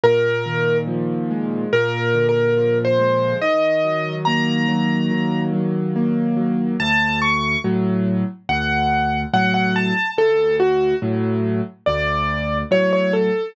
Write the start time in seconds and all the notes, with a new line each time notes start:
0.04 A#2 A#4
0.46 D#3
0.87 F3
1.31 G#3
1.73 A#2 A#4
2.15 D3
2.29 A#4
2.57 F3
2.85 C5
2.99 G#3
3.42 D#3 D#5
3.84 F#3
4.25 A#3 A#5
4.68 F#3
5.11 D#3
5.53 F#3
5.96 A#3
6.37 F#3
6.80 D2 A5
7.22 C#6
7.64 A2 F#3
8.49 D2 F#5
9.33 A2 F#3 F#5
9.54 F#5
9.76 A5
10.17 D2 A4
10.60 F#4
11.02 A2 F#3
11.86 D2 D5
12.71 A2 F#3 C#5
12.93 C#5
13.13 A4